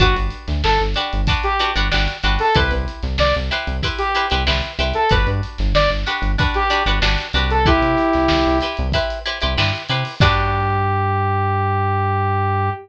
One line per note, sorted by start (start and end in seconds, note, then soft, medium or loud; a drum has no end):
0.00 0.14 G1 loud
0.00 0.51 D4 medium
0.00 0.15 F#4 loud
0.00 0.51 F#4 medium
0.00 0.51 G4 medium
0.00 0.51 B4 medium
0.00 kick medium
0.00 closed hi-hat medium
0.16 0.30 G1 medium
0.16 closed hi-hat medium
0.30 closed hi-hat medium
0.48 0.62 D2 loud
0.48 snare medium
0.48 closed hi-hat medium
0.64 0.79 G1 medium
0.64 0.79 A4 medium
0.64 snare loud
0.78 0.95 G1 medium
0.78 closed hi-hat medium
0.94 1.21 D4 medium
0.94 1.21 F#4 medium
0.94 1.21 G4 medium
0.94 1.21 B4 medium
0.94 snare soft
0.94 closed hi-hat medium
1.13 1.28 G1 loud
1.13 closed hi-hat medium
1.27 1.53 D4 medium
1.27 1.53 F#4 medium
1.27 1.53 G4 medium
1.27 1.53 B4 medium
1.27 kick medium
1.27 closed hi-hat loud
1.43 1.70 G4 medium
1.43 closed hi-hat medium
1.59 1.72 D4 medium
1.59 1.72 F#4 medium
1.59 1.72 G4 medium
1.59 1.72 B4 medium
1.59 closed hi-hat medium
1.76 1.90 G1 medium
1.76 1.88 D4 medium
1.76 1.88 F#4 medium
1.76 1.88 G4 medium
1.76 1.88 B4 medium
1.76 closed hi-hat medium
1.91 2.07 G1 medium
1.91 2.17 D4 medium
1.91 2.17 F#4 medium
1.91 2.17 G4 medium
1.91 2.17 B4 medium
1.91 snare loud
2.08 closed hi-hat medium
2.23 2.38 G1 loud
2.23 2.49 D4 medium
2.23 2.49 F#4 medium
2.23 2.49 G4 medium
2.23 2.49 B4 medium
2.23 closed hi-hat medium
2.39 2.55 A4 medium
2.39 open hi-hat medium
2.55 2.70 C2 loud
2.55 3.06 E4 loud
2.55 3.06 G4 medium
2.55 2.71 B4 medium
2.55 3.06 B4 medium
2.55 3.06 C5 medium
2.55 kick medium
2.55 closed hi-hat loud
2.71 2.86 C2 loud
2.71 snare soft
2.71 closed hi-hat medium
2.88 closed hi-hat medium
3.03 3.17 C2 loud
3.03 snare soft
3.03 closed hi-hat medium
3.18 3.33 C2 loud
3.18 3.34 D5 medium
3.18 snare loud
3.35 3.51 C2 loud
3.35 closed hi-hat medium
3.51 3.77 E4 medium
3.51 3.77 G4 medium
3.51 3.77 B4 medium
3.51 3.77 C5 medium
3.51 snare soft
3.51 closed hi-hat medium
3.67 3.82 C2 loud
3.67 closed hi-hat medium
3.83 4.09 E4 medium
3.83 4.09 G4 medium
3.83 4.09 B4 medium
3.83 4.09 C5 medium
3.83 kick medium
3.83 closed hi-hat medium
3.98 4.26 G4 medium
3.98 closed hi-hat medium
4.15 4.28 E4 medium
4.15 4.28 G4 medium
4.15 4.28 B4 medium
4.15 4.28 C5 medium
4.15 closed hi-hat medium
4.30 4.46 C2 loud
4.30 4.44 E4 medium
4.30 4.44 G4 medium
4.30 4.44 B4 medium
4.30 4.44 C5 medium
4.30 closed hi-hat medium
4.47 4.62 C2 loud
4.47 4.72 E4 medium
4.47 4.72 G4 medium
4.47 4.72 B4 medium
4.47 4.72 C5 medium
4.47 snare loud
4.62 closed hi-hat medium
4.79 4.93 C2 loud
4.79 5.04 E4 medium
4.79 5.04 G4 medium
4.79 5.04 B4 medium
4.79 5.04 C5 medium
4.79 closed hi-hat medium
4.94 5.10 A4 medium
4.94 closed hi-hat medium
5.09 5.26 G1 loud
5.09 5.62 D4 medium
5.09 5.62 F#4 medium
5.09 5.62 G4 medium
5.09 5.26 B4 loud
5.09 5.62 B4 medium
5.09 kick medium
5.09 closed hi-hat medium
5.27 5.41 G2 loud
5.27 closed hi-hat medium
5.43 closed hi-hat medium
5.58 5.73 G1 loud
5.58 snare medium
5.58 closed hi-hat medium
5.74 5.88 G1 medium
5.74 5.90 D5 loud
5.74 snare loud
5.90 6.05 G1 medium
5.90 closed hi-hat medium
6.06 6.32 D4 medium
6.06 6.32 F#4 medium
6.06 6.32 G4 medium
6.06 6.32 B4 medium
6.06 closed hi-hat medium
6.22 6.36 G1 loud
6.22 closed hi-hat medium
6.38 6.64 D4 medium
6.38 6.64 F#4 medium
6.38 6.64 G4 medium
6.38 6.64 B4 medium
6.38 kick medium
6.38 closed hi-hat medium
6.54 6.83 G4 medium
6.54 snare soft
6.54 closed hi-hat medium
6.70 6.83 D4 medium
6.70 6.83 F#4 medium
6.70 6.83 G4 medium
6.70 6.83 B4 medium
6.70 closed hi-hat medium
6.86 7.00 G1 loud
6.86 6.99 D4 medium
6.86 6.99 F#4 medium
6.86 6.99 G4 medium
6.86 6.99 B4 medium
6.86 closed hi-hat medium
7.02 7.17 G1 loud
7.02 7.28 D4 medium
7.02 7.28 F#4 medium
7.02 7.28 G4 medium
7.02 7.28 B4 medium
7.02 snare loud
7.18 snare soft
7.18 closed hi-hat medium
7.33 7.80 C2 loud
7.33 7.60 D4 medium
7.33 7.60 F#4 medium
7.33 7.60 G4 medium
7.33 7.60 B4 medium
7.33 closed hi-hat medium
7.51 7.66 A4 medium
7.51 closed hi-hat medium
7.66 8.17 E4 medium
7.66 8.58 E4 loud
7.66 8.17 G4 medium
7.66 8.58 G4 loud
7.66 8.17 B4 medium
7.66 8.17 C5 medium
7.66 kick loud
7.66 closed hi-hat medium
7.82 7.96 C3 medium
7.82 closed hi-hat medium
7.97 snare soft
7.97 closed hi-hat medium
8.13 8.29 C2 medium
8.13 snare medium
8.13 closed hi-hat medium
8.28 8.45 C2 loud
8.28 snare loud
8.46 8.61 C2 loud
8.46 closed hi-hat medium
8.61 8.87 E4 medium
8.61 8.87 G4 medium
8.61 8.87 B4 medium
8.61 8.87 C5 medium
8.61 closed hi-hat medium
8.77 8.93 C2 loud
8.77 closed hi-hat medium
8.92 9.19 E4 loud
8.92 9.19 G4 medium
8.92 9.19 B4 medium
8.92 9.19 C5 medium
8.92 kick medium
8.92 closed hi-hat medium
9.10 closed hi-hat medium
9.26 9.38 E4 medium
9.26 9.38 G4 medium
9.26 9.38 B4 medium
9.26 9.38 C5 medium
9.26 closed hi-hat medium
9.41 9.57 C2 loud
9.41 9.54 E4 medium
9.41 9.54 G4 medium
9.41 9.54 B4 medium
9.41 9.54 C5 medium
9.41 closed hi-hat medium
9.57 9.72 G2 medium
9.57 9.83 E4 medium
9.57 9.83 G4 medium
9.57 9.83 B4 medium
9.57 9.83 C5 medium
9.57 snare loud
9.75 closed hi-hat medium
9.89 10.04 C3 loud
9.89 10.15 E4 medium
9.89 10.15 G4 medium
9.89 10.15 B4 medium
9.89 10.15 C5 medium
9.89 closed hi-hat medium
10.05 open hi-hat medium
10.20 12.70 G2 medium
10.20 12.70 D4 loud
10.20 12.70 F#4 loud
10.20 12.70 G4 loud
10.20 12.70 B4 loud
10.20 kick loud
10.20 crash loud